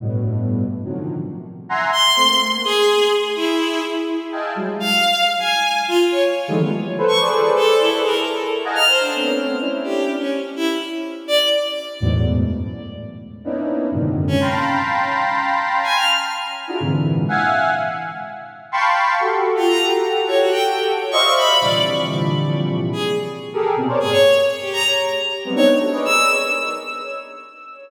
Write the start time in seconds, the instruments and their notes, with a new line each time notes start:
0.00 lead 1 (square) G2 A2 B2
0.84 lead 1 (square) C3 D3 D#3 F3 F#3
1.69 lead 1 (square) E5 F#5 G#5 A#5 C6
1.93 violin C6
2.16 lead 1 (square) A3 A#3 C4
2.64 violin G#4
3.36 violin E4
4.32 lead 1 (square) D#5 E5 F5 G5 G#5 A5
4.55 lead 1 (square) F#3 G3 G#3
4.80 violin F5
5.39 violin G#5
5.88 violin F4
6.11 violin C#5
6.48 lead 1 (square) D#3 E3 F3 G3 G#3 A3
6.59 lead 1 (square) F#3 G3 A3 B3
6.98 lead 1 (square) A4 B4 C5
7.08 violin C#6
7.20 lead 1 (square) G#4 A4 B4 C5 D5
7.56 violin A4
7.80 violin E4
7.92 lead 1 (square) G#4 A4 B4
8.05 violin A#4
8.64 lead 1 (square) D#5 F5 F#5 G#5 A5 A#5
8.75 violin F6
8.87 violin C5
9.01 violin D4
9.14 lead 1 (square) A3 B3 C4 C#4
9.61 lead 1 (square) C#4 D4 E4
9.84 violin G4
10.19 violin C#4
10.56 violin E4
11.28 violin D5
12.00 lead 1 (square) E2 F#2 G#2 A2 B2
13.44 lead 1 (square) A#3 B3 C#4 D4 D#4 E4
13.91 lead 1 (square) F#2 G#2 A#2 C3 D3 D#3
14.28 violin C#4
14.40 lead 1 (square) F5 G5 A5 A#5 B5 C6
15.83 violin G#5
15.96 violin F6
16.67 lead 1 (square) D4 E4 F4 F#4 G#4 A#4
16.80 lead 1 (square) G#2 A#2 C3 D3 E3
17.29 lead 1 (square) E5 F5 F#5 G#5
18.72 lead 1 (square) F5 G5 A5 B5 C6 C#6
19.20 lead 1 (square) F#4 G4 A4
19.56 violin F4
19.68 violin A#5
20.28 violin C#5
20.40 violin F#4
20.52 violin G5
21.11 lead 1 (square) C5 D5 D#5 E5 F5, violin C#6
21.36 violin B5
21.60 lead 1 (square) A#2 C3 D3 E3 F3 G3, violin D5
22.93 violin G#4
23.53 lead 1 (square) G4 G#4 A4 A#4
23.76 lead 1 (square) B2 C3 C#3
23.88 lead 1 (square) A#4 C5 C#5 D5
23.99 lead 1 (square) G2 A2 B2, violin G#4
24.12 violin C#5
24.61 violin G4
24.73 violin A#5
25.45 lead 1 (square) F#3 G3 G#3 A#3 B3 C4
25.55 lead 1 (square) B3 C4 D4 D#4, violin C#5
25.79 lead 1 (square) F#4 G4 A4
25.92 lead 1 (square) G#4 A#4 B4 C#5 D5 D#5
26.05 violin E6